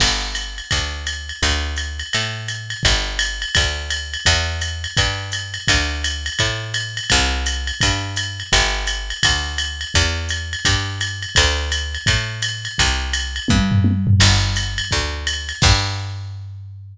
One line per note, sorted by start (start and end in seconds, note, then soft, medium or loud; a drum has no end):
0.00 0.61 G1 medium
0.00 kick medium
0.00 crash loud
0.00 ride loud
0.35 hi-hat pedal medium
0.35 ride medium
0.58 ride medium
0.71 1.32 D2 medium
0.71 kick medium
0.71 ride loud
1.07 hi-hat pedal medium
1.07 ride medium
1.29 ride medium
1.42 2.03 D2 medium
1.42 kick medium
1.42 ride loud
1.76 hi-hat pedal medium
1.76 ride medium
1.99 ride medium
2.13 2.75 A2 medium
2.13 ride loud
2.48 hi-hat pedal medium
2.48 ride medium
2.70 ride medium
2.83 3.45 G1 medium
2.83 kick medium
2.83 ride loud
3.19 hi-hat pedal medium
3.19 ride loud
3.42 ride medium
3.55 4.17 D2 medium
3.55 kick medium
3.55 ride loud
3.90 hi-hat pedal medium
3.90 ride loud
4.14 ride medium
4.25 4.87 E2 medium
4.25 kick medium
4.25 ride loud
4.61 hi-hat pedal medium
4.61 ride medium
4.84 ride medium
4.97 5.58 G2 medium
4.97 kick medium
4.97 ride loud
5.32 hi-hat pedal medium
5.32 ride medium
5.54 ride medium
5.68 6.30 D2 medium
5.68 kick medium
5.68 ride loud
6.04 hi-hat pedal loud
6.04 ride loud
6.26 ride medium
6.39 7.00 A2 medium
6.39 kick medium
6.39 ride loud
6.74 hi-hat pedal medium
6.74 ride loud
6.97 ride medium
7.10 7.72 C2 loud
7.10 kick medium
7.10 ride loud
7.46 hi-hat pedal loud
7.46 ride medium
7.67 ride medium
7.81 8.43 G2 medium
7.81 kick medium
7.81 ride loud
8.16 hi-hat pedal loud
8.16 ride loud
8.40 ride medium
8.52 9.13 G1 medium
8.52 kick medium
8.52 ride loud
8.87 hi-hat pedal loud
8.87 ride medium
9.10 ride medium
9.23 9.85 D2 medium
9.23 kick medium
9.23 ride loud
9.58 hi-hat pedal medium
9.58 ride loud
9.81 ride medium
9.94 10.56 E2 medium
9.94 kick medium
9.94 ride loud
10.29 hi-hat pedal medium
10.29 ride medium
10.53 ride medium
10.65 11.26 G2 medium
10.65 kick medium
10.65 ride loud
11.01 hi-hat pedal medium
11.01 ride loud
11.22 ride medium
11.35 11.98 D2 medium
11.35 kick medium
11.35 ride loud
11.72 hi-hat pedal loud
11.72 ride loud
11.95 ride medium
12.06 12.68 A2 medium
12.06 kick medium
12.06 ride loud
12.42 hi-hat pedal medium
12.42 ride loud
12.65 ride medium
12.78 13.40 C2 medium
12.78 kick medium
12.78 ride loud
13.13 hi-hat pedal loud
13.13 ride loud
13.36 ride medium
13.48 14.11 G2 medium
13.48 kick medium
13.48 high tom loud
13.72 floor tom loud
13.84 high tom medium
14.07 floor tom loud
14.20 14.81 G1 medium
14.20 kick medium
14.20 crash loud
14.20 ride loud
14.56 hi-hat pedal loud
14.56 ride medium
14.78 ride loud
14.91 15.53 D2 medium
14.91 kick medium
14.91 ride medium
15.27 hi-hat pedal medium
15.27 ride loud
15.49 ride medium
15.62 16.97 G2 medium
15.62 kick loud
15.62 crash loud